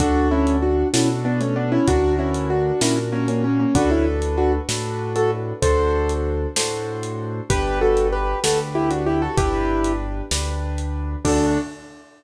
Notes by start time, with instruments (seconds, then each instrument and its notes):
0.00 acoustic grand piano D2 D4 F#4 A4, kick, closed hi-hat
0.31 acoustic grand piano C#4 E4
0.47 closed hi-hat
0.62 acoustic grand piano D4 F#4
0.93 acoustic grand piano B2 C#4 D4 E4 F#4 A4, snare
1.25 acoustic grand piano B3 D4
1.41 acoustic grand piano A3 C#4, closed hi-hat
1.56 acoustic grand piano B3 D4
1.72 acoustic grand piano C#4 E4
1.88 acoustic grand piano D2 D4 F#4 A#4, kick, closed hi-hat
2.19 acoustic grand piano C#4 E4
2.34 closed hi-hat
2.50 acoustic grand piano D4 F#4
2.81 acoustic grand piano A#2 C#4 D4 E4 F#4 A#4, snare
3.12 acoustic grand piano A#3 C#4
3.28 acoustic grand piano A#3 C#4, closed hi-hat
3.44 acoustic grand piano A#3 C#4
3.60 acoustic grand piano A#3 C#4
3.75 acoustic grand piano D2 D4 F#4 A4 B4, kick, closed hi-hat
3.91 acoustic grand piano C#4 E4
4.22 closed hi-hat
4.38 acoustic grand piano D4 F#4
4.69 acoustic grand piano A2 D4 F#4 A4 B4, snare
5.16 acoustic grand piano F#4 A4, closed hi-hat
5.62 acoustic grand piano D2 D4 F#4 A4 C5, kick, closed hi-hat
6.09 closed hi-hat
6.56 acoustic grand piano A2 D4 F#4 A4 C5, snare
7.03 closed hi-hat
7.50 acoustic grand piano G1 D4 G4 B4, kick, closed hi-hat
7.81 acoustic grand piano F#4 A4
7.97 closed hi-hat
8.12 acoustic grand piano G4 B4
8.44 acoustic grand piano D2 D4 F#4 G4 A4 B4, snare
8.75 acoustic grand piano E4 G4
8.91 acoustic grand piano D4 F#4, closed hi-hat
9.06 acoustic grand piano E4 G4
9.22 acoustic grand piano F#4 A4
9.37 acoustic grand piano G1 D4 E4 G4 B4, kick, closed hi-hat
9.84 closed hi-hat
10.31 acoustic grand piano D2 D4 G4 B4, snare
10.78 closed hi-hat
11.25 acoustic grand piano D2 D4 F#4 A4, kick, crash